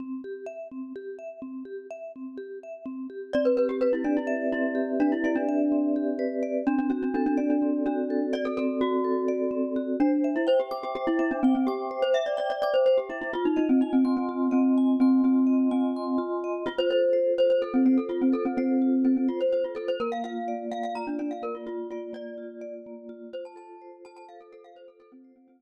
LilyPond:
<<
  \new Staff \with { instrumentName = "Glockenspiel" } { \time 7/8 \key c \major \tempo 4 = 126 r2. r8 | r2. r8 | d''16 b'16 b'16 g'16 b'16 e'16 d'16 e'8. e'4 | d'16 e'16 e'16 d'4.~ d'16 r4 |
d'16 d'16 d'16 d'16 d'16 d'16 d'16 d'8. d'4 | d''16 a'16 a'8 fis'2~ fis'8 | d'8. e'16 c''16 g'16 g'16 g'16 g'16 e'16 e'16 d'16 c'16 c'16 | g'8. c''16 e''16 d''16 d''16 d''16 d''16 c''16 c''16 g'16 e'16 e'16 |
f'16 ees'16 ees'16 c'16 ees'16 c'16 c'16 c'8. c'4 | c'8 c'4 c'4 r4 | \key f \major f'16 c''16 c''4 c''16 c''16 a'16 c'16 c'16 a'16 f'16 c'16 | a'16 c'16 c'4 c'16 c'16 f'16 c''16 c''16 f'16 a'16 c''16 |
bes'16 f''16 f''4 f''16 f''16 bes''16 d'16 d'16 f''16 bes'16 f'16 | f'8 f'8 d''4. r4 | c''16 a''16 a''4 a''16 a''16 f''16 a'16 a'16 f''16 c''16 a'16 | a'16 c'8 c'16 c'16 c'2~ c'16 | }
  \new Staff \with { instrumentName = "Vibraphone" } { \time 7/8 \key c \major c'8 g'8 e''8 c'8 g'8 e''8 c'8 | g'8 e''8 c'8 g'8 e''8 c'8 g'8 | c'8 g'8 b'8 d''8 e''8 c'8 g'8 | b'8 d''8 e''8 c'8 g'8 b'8 d''8 |
c'8 fis'8 a'8 d''8 c'8 fis'8 a'8 | d''8 c'8 fis'8 a'8 d''8 c'8 fis'8 | c''8 e''8 g''8 d'''8 c''8 e''8 g''8 | d'''8 c''8 e''8 g''8 d'''8 c''8 e''8 |
f'8 ees''8 aes''8 c'''8 f'8 ees''8 aes''8 | c'''8 f'8 ees''8 aes''8 c'''8 f'8 ees''8 | \key f \major f'8 a'8 c''8 f'8 a'8 c''8 f'8 | a'8 c''8 f'8 a'8 c''8 f'8 a'8 |
bes8 f'8 d''8 bes8 f'8 d''8 bes8 | f'8 d''8 bes8 f'8 d''8 bes8 f'8 | f'8 a'8 c''8 f'8 a'8 c''8 f'8 | a'8 c''8 f'8 r2 | }
>>